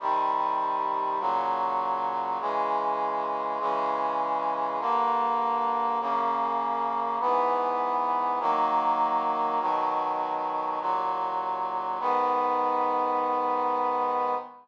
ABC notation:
X:1
M:2/2
L:1/8
Q:1/2=50
K:G#m
V:1 name="Brass Section"
[=C,_E,=G,]4 [A,,^C,F,]4 | [C,E,G,]4 [C,E,G,]4 | [=G,,=D,_B,]4 [F,,C,A,]4 | [G,,E,B,]4 [D,F,A,]4 |
[B,,D,F,]4 [D,,A,,F,]4 | [G,,D,B,]8 |]